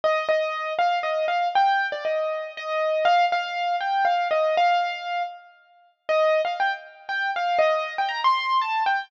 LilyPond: \new Staff { \time 3/4 \key c \dorian \tempo 4 = 119 ees''8 ees''4 f''8 ees''8 f''8 | g''8. d''16 ees''4 ees''4 | f''8 f''4 g''8 f''8 ees''8 | f''4. r4. |
ees''8. f''16 g''16 r8. g''8 f''8 | ees''8. g''16 bes''16 c'''8. a''8 g''8 | }